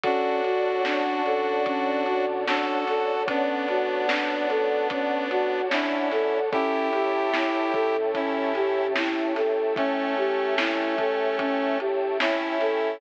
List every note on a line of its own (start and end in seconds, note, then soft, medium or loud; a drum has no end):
0.04 0.39 D2 medium
0.04 0.41 C#4 medium
0.04 6.41 C#4 medium
0.04 6.41 D4 medium
0.04 2.26 D4 medium
0.04 6.41 F#4 medium
0.04 2.26 F#4 loud
0.04 6.41 A4 medium
0.04 6.47 C#5 medium
0.04 6.47 D5 medium
0.04 6.47 F#5 medium
0.04 6.47 A5 medium
0.04 kick medium
0.04 closed hi-hat medium
0.44 0.80 F2 medium
0.44 0.82 F#4 medium
0.44 closed hi-hat medium
0.85 1.20 D2 medium
0.85 1.23 D4 medium
0.85 snare medium
1.25 2.66 A2 medium
1.25 1.63 A4 medium
1.25 closed hi-hat medium
1.66 2.04 C#4 medium
1.66 kick medium
1.66 closed hi-hat medium
2.06 2.44 F#4 medium
2.06 closed hi-hat medium
2.47 2.85 D4 medium
2.47 3.23 F#4 medium
2.47 3.23 A4 medium
2.47 snare medium
2.87 5.98 D2 medium
2.87 3.25 A4 medium
2.87 snare soft
2.87 closed hi-hat medium
3.28 5.61 B3 medium
3.28 3.66 C#4 medium
3.28 5.61 D4 loud
3.28 kick medium
3.28 closed hi-hat medium
3.68 4.06 F#4 medium
3.68 closed hi-hat medium
4.09 4.47 D4 medium
4.09 snare loud
4.49 4.87 A4 medium
4.49 snare soft
4.49 closed hi-hat medium
4.90 5.28 C#4 medium
4.90 kick medium
4.90 closed hi-hat loud
5.30 5.68 F#4 medium
5.30 closed hi-hat medium
5.71 6.39 C#4 medium
5.71 6.09 D4 medium
5.71 6.39 E4 medium
5.71 snare medium
6.11 6.88 C#2 medium
6.11 6.49 A4 medium
6.11 snare soft
6.11 closed hi-hat medium
6.53 12.90 C#4 medium
6.53 6.90 C#4 medium
6.53 7.96 E4 loud
6.53 12.90 E4 medium
6.53 7.96 G4 loud
6.53 12.90 G4 medium
6.53 12.90 A4 medium
6.53 12.96 C#5 medium
6.53 12.96 E5 medium
6.53 12.96 G5 medium
6.53 12.96 A5 medium
6.53 kick medium
6.53 closed hi-hat medium
6.93 7.28 E2 medium
6.93 7.31 G4 medium
6.93 closed hi-hat medium
7.34 7.69 C#2 medium
7.34 7.72 E4 medium
7.34 snare medium
7.74 9.14 G#2 medium
7.74 8.11 A4 medium
7.74 kick medium
7.74 closed hi-hat medium
8.15 8.87 C#4 medium
8.15 8.53 C#4 medium
8.15 8.87 E4 medium
8.15 kick medium
8.15 closed hi-hat medium
8.55 8.93 G4 medium
8.55 closed hi-hat medium
8.96 9.34 E4 medium
8.96 snare medium
9.36 12.48 C#2 medium
9.36 9.74 A4 medium
9.36 snare soft
9.36 closed hi-hat medium
9.76 11.79 A3 medium
9.76 10.15 C#4 medium
9.76 11.79 C#4 loud
9.76 kick medium
9.76 closed hi-hat medium
10.17 10.55 G4 medium
10.17 closed hi-hat soft
10.58 10.96 E4 medium
10.58 snare loud
10.98 11.36 A4 medium
10.98 kick medium
10.98 closed hi-hat medium
11.39 11.77 C#4 medium
11.39 kick medium
11.39 closed hi-hat medium
11.80 12.18 G4 medium
11.80 closed hi-hat medium
12.20 12.97 C#4 medium
12.20 12.97 E4 loud
12.20 12.58 E4 medium
12.20 snare medium
12.61 12.98 A4 medium
12.61 snare soft
12.61 closed hi-hat medium